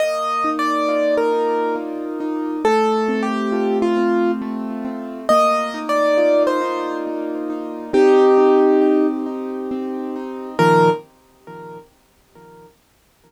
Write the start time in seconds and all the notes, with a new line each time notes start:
0.00 A#3 D#5
0.44 D#4
0.59 D5
0.88 F4
1.17 A#4
1.32 D#4
1.76 A#3
2.20 D#4
2.65 A3 A4
3.08 C4
3.23 G4
3.52 F4
3.82 F4
3.97 C4
4.42 A3
4.85 C4
5.29 A#3 D#5
5.74 D#4
5.89 D5
6.17 F4
6.47 C5
6.61 D#4
7.07 A#3
7.50 D#4
7.93 C4 D#4 G4
8.38 D#4
8.81 G4
9.26 D#4
9.71 C4
10.16 D#4
10.59 A#2 D#3 F3 A#4